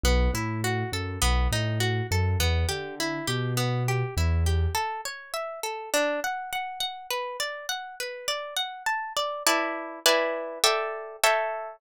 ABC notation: X:1
M:4/4
L:1/8
Q:1/4=102
K:G
V:1 name="Orchestral Harp"
B, E F A B, ^D F A | B, G E G B, G E G | [K:A] A c e A D f f f | B d f B d f a d |
[EBda]2 [EBdg]2 [Ade=g]2 [Aceg]2 |]
V:2 name="Acoustic Grand Piano" clef=bass
B,,, A,,2 F,, B,,, A,,2 F,, | E,, D,2 B,,3 E,,2 | [K:A] z8 | z8 |
z8 |]